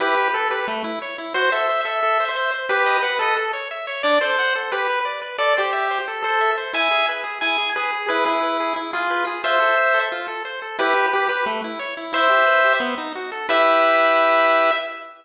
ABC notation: X:1
M:4/4
L:1/16
Q:1/4=178
K:Em
V:1 name="Lead 1 (square)"
[GB]4 A2 B2 z8 | c2 e4 e5 c3 z2 | [GB]4 B2 A2 z8 | d2 c4 z2 B4 z4 |
[K:Am] d2 G6 z2 A4 z2 | [e^g]4 z4 g4 ^G4 | B2 E6 z2 F4 z2 | [ce]8 z8 |
[K:Em] [GB]4 G2 B2 z8 | [ce]8 z8 | e16 |]
V:2 name="Lead 1 (square)"
E2 G2 B2 G2 A,2 E2 ^c2 E2 | F2 A2 c2 A2 A2 c2 e2 c2 | B2 ^d2 f2 d2 A2 ^c2 e2 c2 | D2 A2 f2 A2 G2 B2 d2 B2 |
[K:Am] A2 c2 e2 c2 A2 c2 e2 c2 | E2 ^G2 B2 G2 E2 G2 B2 G2 | E2 ^G2 B2 G2 E2 G2 B2 G2 | F2 A2 c2 A2 F2 A2 c2 A2 |
[K:Em] E2 G2 B2 G2 A,2 E2 ^c2 E2 | E2 G2 B2 G2 B,2 ^D2 F2 A2 | [EGB]16 |]